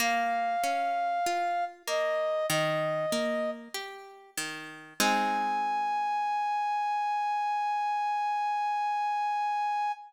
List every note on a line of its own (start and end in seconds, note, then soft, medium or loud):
0.00 0.56 A#3 loud
0.00 1.65 F5 medium
0.64 1.20 C#4 medium
1.26 1.83 F4 medium
1.87 2.44 A#3 medium
1.87 2.46 D#5 medium
2.49 3.06 D#3 loud
2.49 3.51 D#5 medium
3.12 3.68 A#3 medium
3.74 4.31 G4 medium
4.38 4.94 D#3 medium
5.00 9.92 G#3 loud
5.00 9.92 C4 medium
5.00 9.92 D#4 loud
5.00 9.92 G#5 loud